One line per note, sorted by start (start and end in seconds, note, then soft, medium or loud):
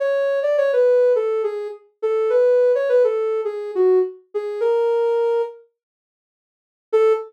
0.00 0.40 C#5 medium
0.43 0.56 D5 medium
0.58 0.71 C#5 medium
0.73 1.13 B4 medium
1.16 1.42 A4 medium
1.44 1.68 G#4 medium
2.02 2.31 A4 medium
2.30 2.72 B4 medium
2.75 2.89 C#5 medium
2.89 3.03 B4 medium
3.04 3.41 A4 medium
3.45 3.71 G#4 medium
3.75 3.99 F#4 medium
4.34 4.61 G#4 medium
4.60 5.42 A#4 medium
6.93 7.13 A4 loud